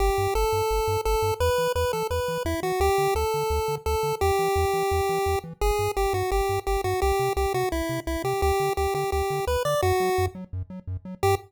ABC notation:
X:1
M:4/4
L:1/8
Q:1/4=171
K:G
V:1 name="Lead 1 (square)"
G2 A4 A2 | B2 B A B2 E F | G2 A4 A2 | G7 z |
_A2 G F G2 G F | G2 G F E2 E G | G2 G G G2 B d | F3 z5 |
G2 z6 |]
V:2 name="Synth Bass 1" clef=bass
G,,, G,, G,,, G,, G,,, G,, G,,, G,, | E,, E, E,, E, E,, E, E,, E, | D,, D, D,, D, D,, D, D,, D, | E,, E, E,, E, E,, E, E,, E, |
G,,, G,, G,,, G,, G,,, G,, G,,, G,, | C,, C, C,, C, C,, C, C,, C, | D,, D, D,, D, D,, D, D,, D, | F,, F, F,, F, F,, F, F,, F, |
G,,2 z6 |]